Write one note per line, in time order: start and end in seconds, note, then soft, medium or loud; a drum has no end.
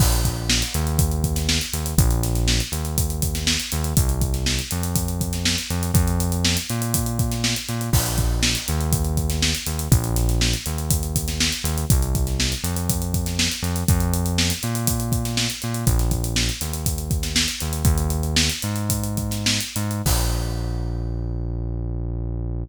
0.00 0.63 A#1 loud
0.00 kick loud
0.00 crash loud
0.12 closed hi-hat medium
0.25 kick medium
0.25 closed hi-hat medium
0.49 snare loud
0.62 closed hi-hat medium
0.74 1.59 D#2 loud
0.74 closed hi-hat medium
0.87 closed hi-hat medium
0.99 kick loud
0.99 closed hi-hat loud
1.11 closed hi-hat medium
1.24 kick medium
1.24 closed hi-hat medium
1.36 snare medium
1.36 closed hi-hat medium
1.49 snare loud
1.61 closed hi-hat medium
1.73 1.94 D#2 medium
1.73 closed hi-hat loud
1.86 closed hi-hat medium
1.98 2.61 A#1 loud
1.98 kick loud
1.98 closed hi-hat loud
2.11 closed hi-hat medium
2.23 snare soft
2.23 closed hi-hat medium
2.35 snare soft
2.35 closed hi-hat medium
2.48 snare loud
2.60 closed hi-hat medium
2.72 3.56 D#2 medium
2.72 closed hi-hat medium
2.85 closed hi-hat medium
2.98 kick loud
2.98 closed hi-hat loud
3.10 closed hi-hat medium
3.22 kick medium
3.22 closed hi-hat loud
3.35 snare medium
3.35 closed hi-hat medium
3.47 snare loud
3.60 closed hi-hat medium
3.72 3.94 D#2 loud
3.72 closed hi-hat loud
3.84 closed hi-hat medium
3.97 4.61 C2 loud
3.97 kick loud
3.97 closed hi-hat loud
4.09 closed hi-hat medium
4.21 kick loud
4.21 closed hi-hat medium
4.34 snare soft
4.34 closed hi-hat medium
4.46 snare loud
4.59 closed hi-hat medium
4.71 5.56 F2 loud
4.71 closed hi-hat medium
4.83 closed hi-hat medium
4.96 kick loud
4.96 closed hi-hat loud
5.08 closed hi-hat medium
5.21 kick medium
5.21 closed hi-hat medium
5.33 snare medium
5.33 closed hi-hat medium
5.45 snare loud
5.58 closed hi-hat medium
5.70 5.91 F2 loud
5.70 closed hi-hat medium
5.83 closed hi-hat medium
5.94 6.57 F2 loud
5.94 kick loud
5.94 closed hi-hat loud
6.08 closed hi-hat medium
6.20 closed hi-hat loud
6.32 closed hi-hat medium
6.45 snare loud
6.57 closed hi-hat medium
6.70 7.54 A#2 loud
6.70 closed hi-hat medium
6.82 closed hi-hat medium
6.94 kick loud
6.94 closed hi-hat loud
7.06 closed hi-hat medium
7.19 kick loud
7.19 closed hi-hat medium
7.32 snare medium
7.32 closed hi-hat medium
7.44 snare loud
7.56 closed hi-hat medium
7.68 7.90 A#2 medium
7.68 snare soft
7.68 closed hi-hat medium
7.81 closed hi-hat medium
7.93 8.56 A#1 loud
7.93 kick loud
7.93 crash loud
8.06 closed hi-hat medium
8.18 kick medium
8.18 closed hi-hat medium
8.43 snare loud
8.55 closed hi-hat medium
8.68 9.53 D#2 loud
8.68 closed hi-hat medium
8.81 closed hi-hat medium
8.92 kick loud
8.92 closed hi-hat loud
9.05 closed hi-hat medium
9.17 kick medium
9.17 closed hi-hat medium
9.30 snare medium
9.30 closed hi-hat medium
9.42 snare loud
9.55 closed hi-hat medium
9.67 9.88 D#2 medium
9.67 closed hi-hat loud
9.79 closed hi-hat medium
9.91 10.55 A#1 loud
9.91 kick loud
9.91 closed hi-hat loud
10.04 closed hi-hat medium
10.16 snare soft
10.16 closed hi-hat medium
10.29 snare soft
10.29 closed hi-hat medium
10.41 snare loud
10.54 closed hi-hat medium
10.66 11.51 D#2 medium
10.66 closed hi-hat medium
10.78 closed hi-hat medium
10.90 kick loud
10.90 closed hi-hat loud
11.03 closed hi-hat medium
11.16 kick medium
11.16 closed hi-hat loud
11.28 snare medium
11.28 closed hi-hat medium
11.40 snare loud
11.52 closed hi-hat medium
11.64 11.85 D#2 loud
11.64 closed hi-hat loud
11.78 closed hi-hat medium
11.90 12.54 C2 loud
11.90 kick loud
11.90 closed hi-hat loud
12.02 closed hi-hat medium
12.15 kick loud
12.15 closed hi-hat medium
12.27 snare soft
12.27 closed hi-hat medium
12.40 snare loud
12.52 closed hi-hat medium
12.64 13.48 F2 loud
12.64 closed hi-hat medium
12.76 closed hi-hat medium
12.89 kick loud
12.89 closed hi-hat loud
13.02 closed hi-hat medium
13.14 kick medium
13.14 closed hi-hat medium
13.26 snare medium
13.26 closed hi-hat medium
13.39 snare loud
13.52 closed hi-hat medium
13.63 13.84 F2 loud
13.63 closed hi-hat medium
13.76 closed hi-hat medium
13.88 14.52 F2 loud
13.88 kick loud
13.88 closed hi-hat loud
14.00 closed hi-hat medium
14.14 closed hi-hat loud
14.26 closed hi-hat medium
14.38 snare loud
14.50 closed hi-hat medium
14.63 15.48 A#2 loud
14.63 closed hi-hat medium
14.75 closed hi-hat medium
14.87 kick loud
14.87 closed hi-hat loud
15.00 closed hi-hat medium
15.12 kick loud
15.12 closed hi-hat medium
15.25 snare medium
15.25 closed hi-hat medium
15.37 snare loud
15.50 closed hi-hat medium
15.62 15.85 A#2 medium
15.62 snare soft
15.62 closed hi-hat medium
15.74 closed hi-hat medium
15.87 16.50 A#1 loud
15.87 kick loud
15.87 closed hi-hat loud
15.99 snare soft
15.99 closed hi-hat medium
16.11 kick medium
16.11 closed hi-hat medium
16.24 closed hi-hat medium
16.36 snare loud
16.49 closed hi-hat medium
16.61 17.46 D#2 medium
16.61 snare soft
16.61 closed hi-hat medium
16.73 closed hi-hat medium
16.86 kick medium
16.86 closed hi-hat loud
16.98 closed hi-hat medium
17.11 kick loud
17.11 closed hi-hat medium
17.23 snare medium
17.23 closed hi-hat medium
17.36 snare loud
17.48 closed hi-hat medium
17.60 17.83 D#2 medium
17.60 closed hi-hat medium
17.73 closed hi-hat medium
17.84 18.49 D#2 loud
17.84 kick loud
17.84 closed hi-hat loud
17.98 closed hi-hat medium
18.10 closed hi-hat medium
18.23 closed hi-hat medium
18.36 snare loud
18.49 snare soft
18.49 closed hi-hat medium
18.62 19.59 G#2 loud
18.62 closed hi-hat medium
18.76 closed hi-hat medium
18.90 kick medium
18.90 closed hi-hat loud
19.04 closed hi-hat medium
19.17 kick medium
19.17 closed hi-hat medium
19.31 snare medium
19.31 closed hi-hat medium
19.46 snare loud
19.60 closed hi-hat medium
19.76 20.02 G#2 loud
19.76 closed hi-hat medium
19.91 closed hi-hat medium
20.06 22.63 A#1 loud
20.06 kick loud
20.06 crash loud